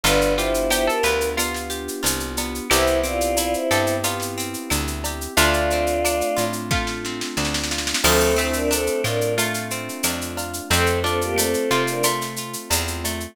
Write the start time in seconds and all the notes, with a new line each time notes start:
0.03 G1 B3 D4 F4 G4 B4, cowbell, shaker
0.21 shaker
0.37 E4 F4 G4 C5, shaker
0.54 shaker
0.70 B3 E4 G4 C5, cowbell, claves, shaker
0.87 A4 A#4, shaker
1.03 D2 F4 B4, shaker
1.21 shaker
1.37 B3 F4, cowbell, claves, shaker
1.54 snare, shaker
1.70 G4, shaker
1.88 shaker
2.03 C2 F4, cowbell, shaker
2.20 shaker
2.37 B3, cowbell, shaker
2.55 shaker
2.70 C2 B3 C4 E4 G4 C5, cowbell, claves, shaker
2.87 shaker
3.03 C4 F4 D5, shaker
3.21 shaker
3.37 E4 F4 D5, cowbell, shaker
3.53 E4 C5, shaker
3.71 G2 G4 A4, claves, shaker
3.87 shaker
4.03 B3 F4, cowbell, shaker
4.20 snare, shaker
4.38 C4, shaker
4.54 shaker
4.70 D2 E4, cowbell, claves, shaker
4.87 shaker
5.04 G4, cowbell, shaker
5.21 shaker
5.36 D2 A3 C4 D4 F4 D5, cowbell, shaker
5.53 shaker
5.70 C4, shaker
5.87 shaker
6.04 D4, cowbell, claves, shaker
6.21 shaker
6.37 A2 F4, shaker
6.53 shaker
6.71 A3 F4, kick, snare
6.87 snare
7.05 C4, snare
7.21 snare
7.37 D2 D4, snare
7.45 snare
7.54 snare
7.63 snare
7.71 F4, snare
7.78 snare
7.87 snare
7.94 snare
8.03 D2 F3 A3 C4 D4 F4 A4, crash, cowbell, claves
8.20 shaker
8.36 A3 C4 E4 C5, shaker
8.53 D4 A#4, shaker
8.71 C4 D4 A4, cowbell, shaker
8.87 shaker
9.04 A2 D4 F4 A#4, claves, shaker
9.21 shaker
9.38 A3 F4, cowbell, shaker
9.54 snare, shaker
9.70 C4, shaker
9.89 shaker
10.03 F2 D4, cowbell, claves, shaker
10.21 shaker
10.37 F4, cowbell, shaker
10.53 shaker
10.70 F2 A3 C4 F4 A4, cowbell, shaker
10.86 shaker
11.04 C4 D4 F4 A4, shaker
11.21 A#3 G4, shaker
11.36 A3 C4 A4, cowbell, claves, shaker
11.54 shaker
11.70 C3 C4 F4, shaker
11.87 D4 A#4, shaker
12.03 A3 F4, cowbell, claves, shaker
12.21 snare, shaker
12.36 F4, shaker
12.53 shaker
12.70 E2 C4, cowbell, shaker
12.88 shaker
13.04 A3, cowbell, shaker
13.20 shaker